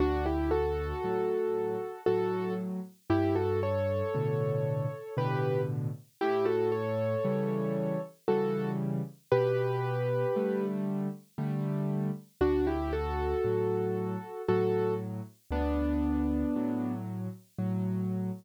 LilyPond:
<<
  \new Staff \with { instrumentName = "Acoustic Grand Piano" } { \time 3/4 \key d \major \tempo 4 = 58 <d' fis'>16 <e' g'>16 <fis' a'>4. <fis' a'>8 r8 | <e' g'>16 <fis' a'>16 <a' cis''>4. <g' b'>8 r8 | <e' g'>16 <fis' a'>16 <a' cis''>4. <fis' a'>8 r8 | <g' b'>4. r4. |
<d' fis'>16 <e' g'>16 <fis' a'>4. <fis' a'>8 r8 | <b d'>4. r4. | }
  \new Staff \with { instrumentName = "Acoustic Grand Piano" } { \time 3/4 \key d \major d,4 <a, fis>4 <a, fis>4 | g,4 <a, b, d>4 <a, b, d>4 | a,4 <cis e g>4 <cis e g>4 | b,4 <d g a>4 <d g a>4 |
d,4 <a, fis>4 <a, fis>4 | d,4 <a, fis>4 <a, fis>4 | }
>>